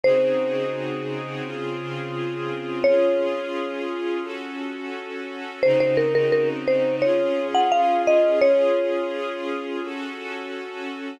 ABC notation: X:1
M:4/4
L:1/16
Q:1/4=86
K:Db
V:1 name="Marimba"
c16 | d16 | c c B B B z c2 d3 g f2 e2 | d16 |]
V:2 name="String Ensemble 1"
[D,CEGA]8 [D,CFA]8 | [DFA]8 [DG=A]8 | [D,CEG]8 [DFA]8 | [DFA]8 [DG=A]8 |]